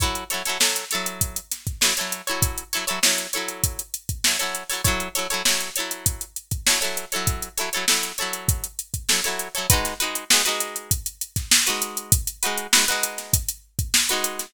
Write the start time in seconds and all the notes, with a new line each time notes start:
0.00 F#3 E4 A4 C#5, kick, closed hi-hat
0.15 closed hi-hat
0.30 F#3 E4 A4 C#5, snare, closed hi-hat
0.45 F#3 E4 A4 C#5, snare, closed hi-hat
0.60 F#3 E4 A4 C#5, snare
0.76 snare, closed hi-hat
0.91 E4 A4 C#5, snare, closed hi-hat
0.95 F#3
1.06 closed hi-hat
1.21 kick, closed hi-hat
1.36 closed hi-hat
1.52 snare, closed hi-hat
1.67 kick, closed hi-hat
1.81 F#3 E4 A4 C#5, snare
1.97 F#3 E4 A4 C#5, closed hi-hat
2.12 closed hi-hat
2.27 F#3 E4 A4 C#5, closed hi-hat
2.42 kick, closed hi-hat
2.58 closed hi-hat
2.73 F#3 E4 A4 C#5, closed hi-hat
2.87 F#3 E4 A4 C#5, closed hi-hat
3.03 F#3 E4 A4 C#5, snare
3.18 closed hi-hat
3.33 E4 A4 C#5, closed hi-hat
3.37 F#3
3.48 closed hi-hat
3.64 kick, closed hi-hat
3.79 closed hi-hat
3.94 closed hi-hat
4.09 kick, closed hi-hat
4.24 F#3 E4 A4 C#5, snare
4.39 F#3 E4 A4 C#5, closed hi-hat
4.55 closed hi-hat
4.70 F#3 E4 A4 C#5, open hi-hat
4.84 F#3 E4 A4 C#5, kick, closed hi-hat
5.00 closed hi-hat
5.15 F#3 E4 A4 C#5, closed hi-hat
5.30 F#3 E4 A4 C#5, closed hi-hat
5.45 F#3 E4 A4 C#5, snare
5.60 closed hi-hat
5.76 E4 A4 C#5, closed hi-hat
5.80 F#3
5.91 closed hi-hat
6.06 kick, closed hi-hat
6.21 closed hi-hat
6.36 closed hi-hat
6.51 kick, closed hi-hat
6.67 F#3 E4 A4 C#5, snare
6.81 F#3 E4 A4 C#5, closed hi-hat
6.97 closed hi-hat
7.12 F#3 E4 A4 C#5, closed hi-hat
7.27 kick, closed hi-hat
7.42 closed hi-hat
7.57 F#3 E4 A4 C#5, closed hi-hat
7.73 F#3 E4 A4 C#5, closed hi-hat
7.88 F#3 E4 A4 C#5, snare
8.03 closed hi-hat
8.18 E4 A4 C#5, closed hi-hat
8.22 F#3
8.33 closed hi-hat
8.48 kick, closed hi-hat
8.64 closed hi-hat
8.79 closed hi-hat
8.94 kick, closed hi-hat
9.09 F#3 E4 A4 C#5, snare
9.24 F#3 E4 A4 C#5, closed hi-hat
9.39 closed hi-hat
9.55 F#3 E4 A4 C#5, closed hi-hat
9.70 G#3 D#4 F#4 B4, kick, closed hi-hat
9.85 snare, closed hi-hat
10.00 G#3 D#4 F#4 B4, closed hi-hat
10.15 closed hi-hat
10.30 G#3 D#4 F#4 B4, snare
10.45 G#3 D#4 F#4 B4, closed hi-hat
10.60 closed hi-hat
10.76 closed hi-hat
10.91 kick, closed hi-hat
11.06 closed hi-hat
11.21 closed hi-hat
11.36 kick, snare, closed hi-hat
11.51 snare
11.66 G#3 D#4 F#4 B4, closed hi-hat
11.82 closed hi-hat
11.97 closed hi-hat
12.12 kick, closed hi-hat
12.27 closed hi-hat
12.43 G#3 D#4 F#4 B4, closed hi-hat
12.58 closed hi-hat
12.73 G#3 D#4 F#4 B4, snare
12.88 G#3 D#4 F#4 B4, closed hi-hat
13.03 closed hi-hat
13.18 snare, closed hi-hat
13.33 kick, closed hi-hat
13.48 closed hi-hat
13.79 kick, closed hi-hat
13.94 snare
14.09 G#3 D#4 F#4 B4, closed hi-hat
14.24 closed hi-hat
14.39 snare, closed hi-hat